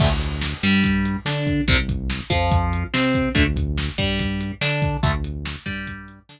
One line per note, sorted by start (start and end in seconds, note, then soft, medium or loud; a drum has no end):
0.00 0.54 D2 medium
0.00 0.09 D3 medium
0.00 0.09 A3 medium
0.00 kick medium
0.00 crash loud
0.21 closed hi-hat medium
0.41 snare medium
0.63 1.17 G2 medium
0.63 1.17 G3 medium
0.63 closed hi-hat medium
0.84 kick medium
0.84 closed hi-hat medium
1.05 closed hi-hat medium
1.25 1.61 D3 medium
1.25 1.62 D4 medium
1.25 snare medium
1.47 kick medium
1.47 closed hi-hat medium
1.67 2.21 C2 loud
1.67 1.76 C3 medium
1.67 1.76 G3 medium
1.67 kick medium
1.67 closed hi-hat medium
1.89 kick medium
1.89 closed hi-hat medium
2.10 snare medium
2.30 2.85 F2 medium
2.30 2.84 F3 medium
2.30 kick medium
2.30 closed hi-hat medium
2.52 kick medium
2.52 closed hi-hat medium
2.73 closed hi-hat medium
2.94 3.29 C3 medium
2.94 3.29 C4 medium
2.94 snare medium
3.15 kick medium
3.15 closed hi-hat medium
3.35 3.90 D2 loud
3.35 3.43 D3 medium
3.35 3.43 A3 medium
3.35 kick medium
3.35 closed hi-hat medium
3.56 kick medium
3.56 closed hi-hat medium
3.78 snare medium
3.98 4.52 G2 medium
3.98 4.52 G3 medium
3.98 kick medium
3.98 closed hi-hat medium
4.19 kick medium
4.19 closed hi-hat medium
4.41 closed hi-hat medium
4.61 4.97 D3 medium
4.61 4.97 D4 medium
4.61 snare medium
4.82 kick medium
4.82 closed hi-hat medium
5.03 5.56 D2 loud
5.03 5.11 D3 medium
5.03 5.11 A3 medium
5.03 kick medium
5.03 closed hi-hat medium
5.24 closed hi-hat medium
5.45 snare loud
5.66 6.20 G2 medium
5.66 6.19 G3 medium
5.66 kick medium
5.66 closed hi-hat medium
5.87 kick medium
5.87 closed hi-hat medium
6.08 closed hi-hat medium
6.29 6.40 D3 loud
6.29 6.40 D4 medium
6.29 snare medium